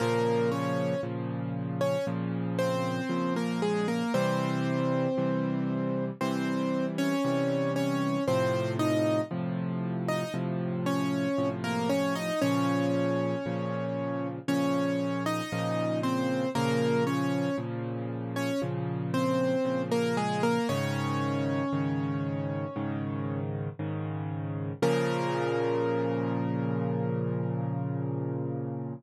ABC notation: X:1
M:4/4
L:1/16
Q:1/4=58
K:Bbm
V:1 name="Acoustic Grand Piano"
[B,B]2 [Dd]2 z3 [Dd] z2 [Cc]3 [B,B] [A,A] [B,B] | [Cc]8 [Cc]3 [Dd]3 [Dd]2 | [Cc]2 [Ee]2 z3 [Ee] z2 [Dd]3 [B,B] [Dd] [Ee] | [Dd]8 [Dd]3 [Ee]3 [Cc]2 |
[B,B]2 [Dd]2 z3 [Dd] z2 [Cc]3 [B,B] [A,A] [B,B] | [Dd]12 z4 | B16 |]
V:2 name="Acoustic Grand Piano" clef=bass
[B,,D,F,]4 [B,,D,F,]4 [B,,D,F,]4 [B,,D,F,]4 | [C,=E,=G,]4 [C,E,G,]4 [C,E,G,]4 [C,E,G,]4 | [=A,,C,F,]4 [A,,C,F,]4 [A,,C,F,]4 [A,,C,F,]4 | [B,,D,F,]4 [B,,D,F,]4 [B,,D,F,]4 [B,,D,F,]4 |
[B,,D,F,]4 [B,,D,F,]4 [B,,D,F,]4 [B,,D,F,]4 | [A,,D,E,]4 [A,,D,E,]4 [A,,D,E,]4 [A,,D,E,]4 | [B,,D,F,]16 |]